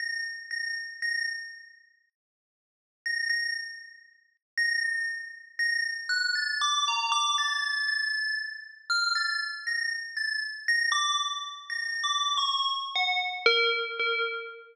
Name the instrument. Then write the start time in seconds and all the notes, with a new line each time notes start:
tubular bells
0.00 A#6
0.51 A#6
1.02 A#6
3.06 A#6
3.29 A#6
4.58 A#6
4.83 A#6
5.59 A#6
6.09 F#6
6.35 A6
6.61 D6
6.88 A#5
7.12 D6
7.38 A6
7.88 A6
8.90 F6
9.15 A6
9.67 A#6
10.17 A6
10.68 A#6
10.92 D6
11.70 A#6
12.04 D6
12.37 C#6
12.96 F#5
13.46 A#4
13.99 A#4